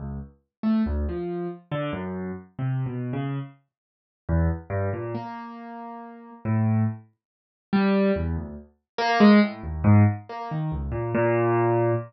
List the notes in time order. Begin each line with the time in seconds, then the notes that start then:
0.00 C#2
0.63 A3
0.86 D2
1.09 F3
1.72 D3
1.93 F#2
2.59 C3
2.86 B2
3.13 C#3
4.29 E2
4.70 G2
4.93 A#2
5.14 A#3
6.45 A2
7.73 G3
8.16 E2
8.37 D2
8.98 A#3
9.20 G#3
9.43 A2
9.63 D#2
9.84 G#2
10.29 A#3
10.51 D#3
10.72 C#2
10.92 A#2
11.15 A#2